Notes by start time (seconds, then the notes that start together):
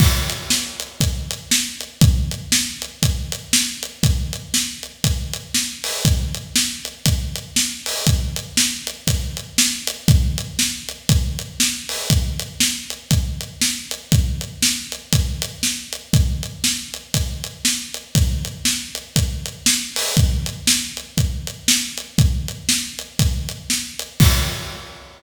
0.00 kick, crash
0.30 closed hi-hat
0.50 snare
0.80 closed hi-hat
1.00 kick, closed hi-hat
1.31 closed hi-hat
1.51 snare
1.81 closed hi-hat
2.01 kick, closed hi-hat
2.31 closed hi-hat
2.52 snare
2.82 closed hi-hat
3.03 kick, closed hi-hat
3.32 closed hi-hat
3.53 snare
3.83 closed hi-hat
4.03 kick, closed hi-hat
4.33 closed hi-hat
4.54 snare
4.83 closed hi-hat
5.04 kick, closed hi-hat
5.33 closed hi-hat
5.54 snare
5.84 open hi-hat
6.05 kick, closed hi-hat
6.34 closed hi-hat
6.56 snare
6.85 closed hi-hat
7.06 kick, closed hi-hat
7.36 closed hi-hat
7.56 snare
7.86 open hi-hat
8.07 kick, closed hi-hat
8.36 closed hi-hat
8.57 snare
8.87 closed hi-hat
9.07 kick, closed hi-hat
9.37 closed hi-hat
9.58 snare
9.87 closed hi-hat
10.08 kick, closed hi-hat
10.38 closed hi-hat
10.59 snare
10.89 closed hi-hat
11.09 kick, closed hi-hat
11.39 closed hi-hat
11.60 snare
11.89 open hi-hat
12.10 kick, closed hi-hat
12.39 closed hi-hat
12.60 snare
12.90 closed hi-hat
13.11 kick, closed hi-hat
13.41 closed hi-hat
13.61 snare
13.91 closed hi-hat
14.12 kick, closed hi-hat
14.41 closed hi-hat
14.62 snare
14.92 closed hi-hat
15.13 kick, closed hi-hat
15.42 closed hi-hat
15.63 snare
15.93 closed hi-hat
16.13 kick, closed hi-hat
16.43 closed hi-hat
16.64 snare
16.94 closed hi-hat
17.14 kick, closed hi-hat
17.44 closed hi-hat
17.65 snare
17.94 closed hi-hat
18.15 kick, closed hi-hat
18.45 closed hi-hat
18.65 snare
18.95 closed hi-hat
19.16 kick, closed hi-hat
19.46 closed hi-hat
19.66 snare
19.96 open hi-hat
20.17 kick, closed hi-hat
20.46 closed hi-hat
20.67 snare
20.97 closed hi-hat
21.18 kick, closed hi-hat
21.47 closed hi-hat
21.68 snare
21.98 closed hi-hat
22.18 kick, closed hi-hat
22.48 closed hi-hat
22.69 snare
22.99 closed hi-hat
23.19 kick, closed hi-hat
23.49 closed hi-hat
23.70 snare
23.99 closed hi-hat
24.20 kick, crash